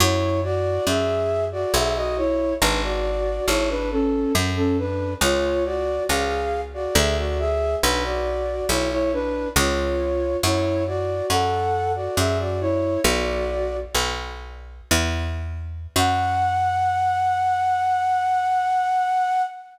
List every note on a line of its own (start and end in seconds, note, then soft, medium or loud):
0.00 0.79 F#2 loud
0.00 0.41 E4 medium
0.00 0.41 C#5 medium
0.43 0.84 F#4 medium
0.43 0.84 D5 medium
0.87 1.65 F#2 medium
0.87 1.45 G#4 medium
0.87 1.45 E5 medium
1.52 1.73 F#4 medium
1.52 1.73 D5 medium
1.74 2.54 B1 loud
1.74 1.95 G#4 medium
1.74 1.95 E5 medium
1.96 2.16 F#4 medium
1.96 2.16 D#5 medium
2.17 2.54 E4 medium
2.17 2.54 C#5 medium
2.61 3.40 G#1 loud
2.61 2.82 D4 medium
2.61 2.82 B4 medium
2.83 3.45 F#4 medium
2.83 3.45 D5 medium
3.48 4.26 G#1 medium
3.48 3.68 E4 medium
3.48 3.68 C#5 medium
3.70 3.90 D4 medium
3.70 3.90 B4 medium
3.91 4.32 C#4 medium
3.91 4.32 A4 medium
4.35 5.15 F#2 loud
4.56 4.77 C#4 medium
4.56 4.77 A4 medium
4.78 5.14 D4 medium
4.78 5.14 B4 medium
5.21 5.99 C#2 loud
5.21 5.64 F4 medium
5.21 5.64 C#5 medium
5.65 6.03 F#4 medium
5.65 6.03 D5 medium
6.09 6.88 C#2 medium
6.09 6.61 G#4 medium
6.09 6.61 F5 medium
6.74 6.95 F#4 medium
6.74 6.95 D5 medium
6.95 7.75 D2 loud
6.95 7.16 G#4 medium
6.95 7.16 E5 medium
7.17 7.38 F#4 medium
7.17 7.38 D5 medium
7.39 7.76 G#4 medium
7.39 7.76 E5 medium
7.83 8.62 B1 loud
7.83 8.03 D4 medium
7.83 8.03 B4 medium
8.04 8.65 F#4 medium
8.04 8.65 D5 medium
8.69 9.47 B1 medium
8.69 8.90 E4 medium
8.69 8.90 C#5 medium
8.91 9.12 E4 medium
8.91 9.12 C#5 medium
9.13 9.49 D4 medium
9.13 9.49 B4 medium
9.56 10.36 C#2 loud
9.56 10.37 F4 medium
9.56 10.37 C#5 medium
10.43 11.22 F#2 loud
10.43 10.84 E4 medium
10.43 10.84 C#5 medium
10.87 11.26 F#4 medium
10.87 11.26 D5 medium
11.30 12.08 F#2 medium
11.30 11.92 A4 medium
11.30 11.92 F#5 medium
11.96 12.16 F#4 soft
11.96 12.16 D5 medium
12.17 12.97 F#2 medium
12.17 12.38 G#4 medium
12.17 12.38 E5 medium
12.39 12.60 F#4 medium
12.39 12.60 D5 medium
12.61 13.00 E4 medium
12.61 13.00 C#5 medium
13.04 13.85 B1 loud
13.04 13.76 F#4 medium
13.04 13.76 D5 medium
13.95 14.81 B1 medium
14.91 15.87 E2 loud
15.96 19.42 F#2 loud
15.96 19.42 F#5 loud